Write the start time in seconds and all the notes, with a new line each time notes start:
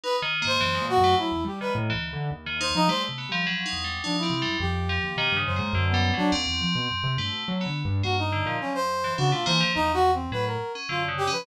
0.04 D#4 B4
0.22 D#3
0.42 G#2 A#3
0.47 C5
0.61 F#2 E3
0.75 G#3
0.81 A#2
0.89 F#4
0.98 F#2
1.04 A3
1.18 F#3 E4
1.32 E2
1.45 G3 G4
1.61 D#3 B4
1.75 A2
1.90 E3
1.94 D2
2.13 D3
2.31 D#2
2.46 D#3
2.61 D#4 C5
2.75 F3 D#4
2.88 G3 A3 C5
3.09 C3
3.18 B3
3.29 F3 G3
3.47 F#3
3.66 D#4
3.73 E2
3.84 G3
4.03 F3 D4 D#4
4.18 E4
4.23 C4
4.30 C3
4.42 F#2 G3
4.60 F2 G4
4.89 F3
5.04 D#2
5.16 B2 D#3
5.32 G2
5.37 C#3
5.46 F#2 C5
5.56 G#2 A#3
5.73 F#2 D3
5.89 B3
5.94 G3
6.14 F#3 D4
6.18 F#3
6.32 D#2 C4
6.47 E2
6.61 F3
6.75 B2
6.91 F#2
7.04 C3
7.17 G2 A3
7.32 B2
7.48 F#3
7.61 B3
7.66 D3
7.85 G2
8.03 G2 A#3 F#4
8.18 D#4
8.33 D3
8.46 A#2 F3
8.61 F#2 C#4
8.75 C5
9.04 E3
9.18 C#3 D4 F#4
9.31 B2 A3 F4
9.46 E3 A#3 C5
9.61 D#2 F3
9.75 E2 D#4
9.94 F#4
10.14 C4
10.32 A2 F#3 B4
10.47 A#4
10.75 C#4
10.89 F#2 D3 F4
11.08 C#3
11.18 G4
11.27 C#4
11.32 F3 B4